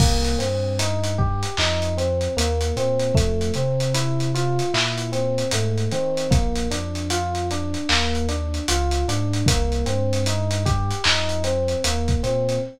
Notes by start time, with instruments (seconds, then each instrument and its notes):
0.00 synth bass 2 C2, electric piano 1 A#3, kick, crash
0.25 closed hi-hat
0.38 synth bass 2 G2, electric piano 1 C4, closed hi-hat
0.79 electric piano 1 D#4, closed hi-hat
1.04 closed hi-hat
1.18 electric piano 1 G4, kick
1.43 closed hi-hat
1.57 synth bass 2 F2, electric piano 1 D#4, clap
1.82 closed hi-hat
1.97 electric piano 1 C4, closed hi-hat
2.21 closed hi-hat
2.37 synth bass 2 D#2, electric piano 1 A#3, closed hi-hat
2.61 closed hi-hat
2.76 synth bass 2 A#2, electric piano 1 C4, closed hi-hat
3.00 closed hi-hat
3.15 synth bass 2 F2, electric piano 1 A3, kick, closed hi-hat
3.41 closed hi-hat
3.54 synth bass 2 C3, electric piano 1 C4, closed hi-hat
3.80 closed hi-hat
3.94 electric piano 1 E4, closed hi-hat
4.20 closed hi-hat
4.35 electric piano 1 F4, closed hi-hat
4.59 closed hi-hat
4.74 synth bass 2 A#2, electric piano 1 E4, clap
4.98 closed hi-hat
5.12 electric piano 1 C4, closed hi-hat
5.38 closed hi-hat
5.51 synth bass 2 G#2, electric piano 1 A3, closed hi-hat
5.78 closed hi-hat
5.91 synth bass 2 D#3, electric piano 1 C4, closed hi-hat
6.17 closed hi-hat
6.31 synth bass 2 A#1, electric piano 1 A#3, kick, closed hi-hat
6.56 closed hi-hat
6.71 synth bass 2 F2, electric piano 1 D4, closed hi-hat
6.95 closed hi-hat
7.10 electric piano 1 F4, closed hi-hat
7.35 closed hi-hat
7.51 electric piano 1 D4, closed hi-hat
7.74 closed hi-hat
7.89 synth bass 2 D#2, electric piano 1 A#3, clap
8.15 closed hi-hat
8.29 electric piano 1 D4, closed hi-hat
8.54 closed hi-hat
8.68 synth bass 2 C#2, electric piano 1 F4, closed hi-hat
8.91 closed hi-hat
9.08 synth bass 2 G#2, electric piano 1 D4, closed hi-hat
9.33 closed hi-hat
9.46 synth bass 2 C2, electric piano 1 A#3, kick, closed hi-hat
9.72 closed hi-hat
9.86 synth bass 2 G2, electric piano 1 C4, closed hi-hat
10.13 closed hi-hat
10.26 electric piano 1 D#4, closed hi-hat
10.51 closed hi-hat
10.65 electric piano 1 G4, kick, closed hi-hat
10.91 closed hi-hat
11.04 synth bass 2 F2, electric piano 1 D#4, clap
11.29 closed hi-hat
11.44 electric piano 1 C4, closed hi-hat
11.68 closed hi-hat
11.84 synth bass 2 D#2, electric piano 1 A#3, closed hi-hat
12.08 kick, closed hi-hat
12.23 synth bass 2 A#2, electric piano 1 C4, closed hi-hat
12.49 closed hi-hat